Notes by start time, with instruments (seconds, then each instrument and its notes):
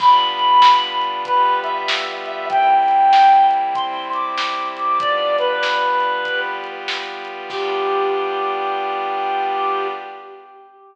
0.00 pad 5 (bowed) G3 B3 D4 F4, clarinet B5, kick, crash
0.39 closed hi-hat
0.62 snare
1.01 closed hi-hat
1.25 pad 5 (bowed) G3 B3 F4 G4, clarinet B4, kick, closed hi-hat
1.63 clarinet E5, closed hi-hat
1.88 snare
2.26 clarinet E5, closed hi-hat
2.49 pad 5 (bowed) C3 G3 A#3 E4, clarinet G5, kick, closed hi-hat
2.88 closed hi-hat
3.13 snare
3.51 closed hi-hat
3.75 pad 5 (bowed) C3 G3 C4 E4, clarinet C6, kick, closed hi-hat
4.13 clarinet D6, closed hi-hat
4.38 snare
4.76 clarinet D6, closed hi-hat
5.00 pad 5 (bowed) G3 B3 D4 F4, clarinet D5, kick, closed hi-hat
5.38 clarinet B4, closed hi-hat
5.63 snare
6.00 closed hi-hat
6.25 pad 5 (bowed) G3 B3 F4 G4, kick, closed hi-hat
6.64 closed hi-hat
6.88 snare
7.25 closed hi-hat
7.50 pad 5 (bowed) G3 B3 D4 F4, clarinet G4, kick, crash